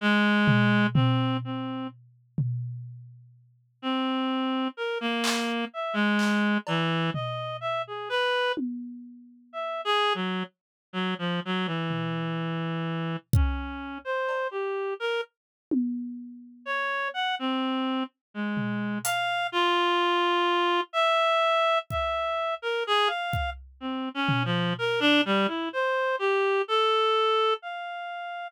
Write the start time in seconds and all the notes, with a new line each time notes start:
0.01 G#3
0.48 floor tom
0.94 C4, floor tom
1.44 C4
2.38 floor tom
3.82 C4
4.77 A#4
5.01 A#3
5.24 clap
5.73 E5
5.93 G#3
6.19 clap
6.67 E3, cowbell
7.14 D#5, floor tom
7.61 E5
7.87 G#4
8.09 B4
8.57 high tom
9.53 E5
9.85 G#4
10.15 F#3
10.93 F#3
11.19 F3
11.45 F#3
11.66 E3
11.90 floor tom
13.33 C#4, kick
14.05 C5
14.29 cowbell
14.51 G4
15.00 A#4
15.71 high tom
16.65 C#5
17.14 F#5
17.39 C4
18.34 G#3
18.57 floor tom
19.04 F5, closed hi-hat
19.52 F4
20.93 E5
21.90 E5, kick
22.62 A#4
22.87 G#4
23.07 F5
23.33 kick
23.80 C4
24.14 C#4
24.29 floor tom
24.45 F3
24.79 A#4
25.00 D4
25.25 G3
25.47 E4
25.73 C5
26.19 G4
26.68 A4
27.62 F5